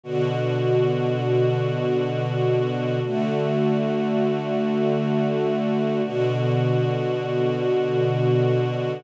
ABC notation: X:1
M:2/4
L:1/8
Q:1/4=80
K:D
V:1 name="String Ensemble 1"
[B,,D,F]4- | [B,,D,F]4 | [D,A,F]4- | [D,A,F]4 |
[B,,D,F]4- | [B,,D,F]4 |]